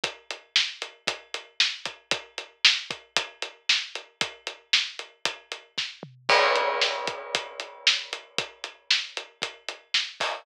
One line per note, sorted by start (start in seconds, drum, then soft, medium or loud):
0.04 kick loud
0.04 closed hi-hat loud
0.30 closed hi-hat medium
0.56 snare loud
0.82 closed hi-hat medium
1.07 kick loud
1.07 closed hi-hat loud
1.34 closed hi-hat medium
1.60 snare loud
1.85 kick medium
1.85 closed hi-hat medium
2.11 kick loud
2.11 closed hi-hat loud
2.38 closed hi-hat medium
2.65 snare loud
2.91 kick loud
2.91 closed hi-hat medium
3.16 kick loud
3.16 closed hi-hat loud
3.42 closed hi-hat medium
3.69 snare loud
3.95 closed hi-hat medium
4.21 kick loud
4.21 closed hi-hat loud
4.47 closed hi-hat medium
4.73 snare loud
4.99 closed hi-hat medium
5.25 kick loud
5.25 closed hi-hat loud
5.52 closed hi-hat medium
5.78 kick medium
5.78 snare medium
6.03 mid tom loud
6.29 kick loud
6.29 crash loud
6.55 closed hi-hat medium
6.81 snare loud
7.07 kick loud
7.07 closed hi-hat medium
7.35 kick loud
7.35 closed hi-hat loud
7.60 closed hi-hat medium
7.87 snare loud
8.13 closed hi-hat medium
8.38 kick loud
8.38 closed hi-hat loud
8.64 closed hi-hat medium
8.90 snare loud
9.17 closed hi-hat medium
9.42 kick loud
9.42 closed hi-hat loud
9.68 closed hi-hat medium
9.94 snare loud
10.20 kick medium
10.20 open hi-hat medium